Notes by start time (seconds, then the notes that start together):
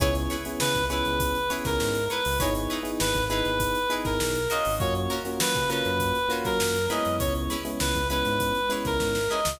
0.00 C#2 B3 C#4 E4 G#4 B4 C#5, kick, closed hi-hat
0.15 snare, closed hi-hat
0.30 E4 G#4 B4 C#5, closed hi-hat
0.45 B3 C#4 E4 G#4, closed hi-hat
0.60 C#3 B4, snare
0.75 C#2, kick, closed hi-hat
0.90 B3 C#4 E4 G#4 B4 C#5, closed hi-hat
1.05 C#2, closed hi-hat
1.20 kick, closed hi-hat
1.35 closed hi-hat
1.50 B3 C#4 E4 G#4 B4 C#5, snare, closed hi-hat
1.65 C#2 A#4, kick, snare, closed hi-hat
1.80 G#2, snare
1.95 closed hi-hat
2.10 E4 G#4 B4 C#5, closed hi-hat
2.25 C#2, open hi-hat
2.39 G#1 B3 D#4 E4 G#4 B4 C#5, kick, closed hi-hat
2.55 closed hi-hat
2.70 D#4 E4 G#4 B4, closed hi-hat
2.83 B3 D#4 E4 G#4, closed hi-hat
3.00 G#1 B4, snare
3.15 G#1, kick, closed hi-hat
3.30 B3 D#4 E4 G#4 B4, snare, closed hi-hat
3.45 G#1, closed hi-hat
3.60 kick, closed hi-hat
3.75 closed hi-hat
3.90 B3 D#4 E4 G#4 B4, closed hi-hat
4.05 G#1 A#4, kick, snare, closed hi-hat
4.20 B1, snare
4.35 closed hi-hat
4.50 C#4 F4 F#4 A#4 D#5, snare, closed hi-hat
4.65 G#1, open hi-hat
4.79 F#2 A#3 C#4 F4 F#4 C#5, kick, closed hi-hat
4.95 closed hi-hat
5.10 C#4 F4 F#4 A#4, closed hi-hat
5.25 A#3 C#4 F4 F#4, closed hi-hat
5.40 F#3 B4, snare
5.55 C#3, kick, closed hi-hat
5.70 A#3 C#4 F4 F#4 A#4 B4, closed hi-hat
5.85 F#2, closed hi-hat
6.00 kick, closed hi-hat
6.15 closed hi-hat
6.29 A#3 C#4 F4 F#4 A#4, closed hi-hat
6.45 F#3 A#4, kick, snare, closed hi-hat
6.60 F#2, snare
6.75 snare, closed hi-hat
6.90 G#3 B3 C#4 E4 G#4 B4 D#5, closed hi-hat
7.05 F#2, closed hi-hat
7.19 C#2 C#5, kick, closed hi-hat
7.35 closed hi-hat
7.50 C#4 E4 G#4 B4, closed hi-hat
7.65 G#3 B3 C#4 E4, closed hi-hat
7.80 C#2 B4, snare
7.95 C#2, kick, closed hi-hat
8.10 G#3 B3 C#4 E4 G#4 B4, closed hi-hat
8.25 G#2, snare, closed hi-hat
8.40 kick, closed hi-hat
8.55 closed hi-hat
8.69 G#3 B3 C#4 E4 G#4 B4, snare, closed hi-hat
8.85 C#2 A#4, kick, snare, closed hi-hat
9.00 G#2, kick, snare
9.15 snare
9.30 C#4 E4 G#4 B4 D#5
9.45 C#2, snare